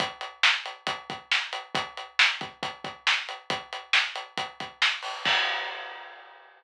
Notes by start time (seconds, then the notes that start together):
0.00 kick, closed hi-hat
0.21 closed hi-hat
0.43 snare
0.66 closed hi-hat
0.87 kick, closed hi-hat
1.10 kick, closed hi-hat
1.31 snare
1.53 closed hi-hat
1.75 kick, closed hi-hat
1.97 closed hi-hat
2.19 snare
2.41 kick, closed hi-hat
2.63 kick, closed hi-hat
2.84 kick, closed hi-hat
3.07 snare
3.29 closed hi-hat
3.50 kick, closed hi-hat
3.73 closed hi-hat
3.93 snare
4.16 closed hi-hat
4.37 kick, closed hi-hat
4.60 kick, closed hi-hat
4.82 snare
5.03 open hi-hat
5.25 kick, crash